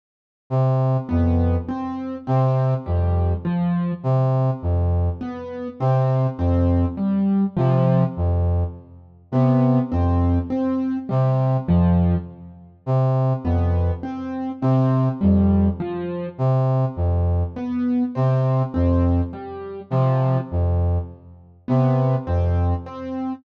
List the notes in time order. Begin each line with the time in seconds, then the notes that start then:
0.50 C3
1.09 F2 B3
1.69 C4
2.27 C3 C4
2.86 F2 G3
3.45 F3
4.03 C3
4.62 F2
5.21 B3
5.80 C3 C4
6.38 F2 C4
6.97 G3
7.57 C3 F3
8.17 F2
9.32 C3 B3
9.92 F2 C4
10.50 C4
11.09 C3 G3
11.67 F2 F3
12.86 C3
13.44 F2 B3
14.03 C4
14.62 C3 C4
15.21 F2 G3
15.80 F3
16.38 C3
16.96 F2
17.56 B3
18.15 C3 C4
18.74 F2 C4
19.33 G3
19.90 C3 F3
20.51 F2
21.68 C3 B3
22.27 F2 C4
22.86 C4